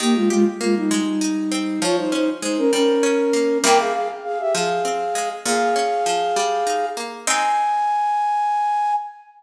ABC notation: X:1
M:6/8
L:1/16
Q:3/8=66
K:Ab
V:1 name="Flute"
[B,G] [A,F] [A,F] z [A,F] [G,E] [G,E]6 | [Fd] [Ec] [Ec] z [Ec] [DB] [DB]6 | [Bg] [Af] [Af] z [Af] [G=e] [Af]6 | [Af]10 z2 |
a12 |]
V:2 name="Harpsichord"
E,2 G2 B,2 A,2 E2 C2 | F,2 D2 A,2 G,2 D2 B,2 | [C,G,B,=E]6 F,2 C2 A,2 | B,,2 D2 F,2 G,2 E2 B,2 |
[A,CE]12 |]